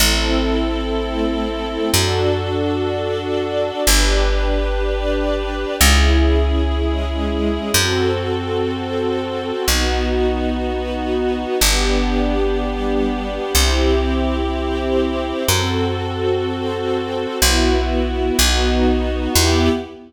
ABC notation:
X:1
M:4/4
L:1/8
Q:1/4=62
K:Em
V:1 name="String Ensemble 1"
[CEA]4 [DFA]4 | [DGB]4 [^CE^G]4 | [CFA]4 [B,^DF]4 | [B,DG]4 [CEG]4 |
[CFA]4 [B,EF]2 [B,^DF]2 | [B,EG]2 z6 |]
V:2 name="String Ensemble 1"
[CEA]2 [A,CA]2 [DFA]2 [DAd]2 | [DGB]2 [DBd]2 [^CE^G]2 [^G,CG]2 | [CFA]2 [CAc]2 [B,^DF]2 [B,FB]2 | [B,DG]2 [G,B,G]2 [CEG]2 [CGc]2 |
[CFA]2 [CAc]2 [B,EF]2 [B,^DF]2 | [B,EG]2 z6 |]
V:3 name="Electric Bass (finger)" clef=bass
A,,,4 F,,4 | G,,,4 ^C,,4 | F,,4 B,,,4 | G,,,4 C,,4 |
F,,4 B,,,2 B,,,2 | E,,2 z6 |]